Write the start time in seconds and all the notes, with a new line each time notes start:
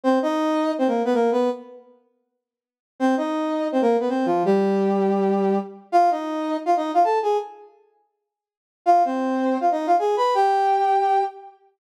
0.04 C4 C5
0.22 D#4 D#5
0.79 C4 C5
0.88 A#3 A#4
1.05 B3 B4
1.14 A#3 A#4
1.32 B3 B4
3.00 C4 C5
3.17 D#4 D#5
3.72 C4 C5
3.82 A#3 A#4
4.00 B3 B4
4.09 C4 C5
4.26 F3 F4
4.45 G3 G4
5.92 F4 F5
6.11 D#4 D#5
6.66 F4 F5
6.77 D#4 D#5
6.94 F4 F5
7.04 A4 A5
7.22 G#4 G#5
8.86 F4 F5
9.05 C4 C5
9.61 F4 F5
9.71 D#4 D#5
9.87 F4 F5
9.99 G#4 G#5
10.17 B4 B5
10.34 G4 G5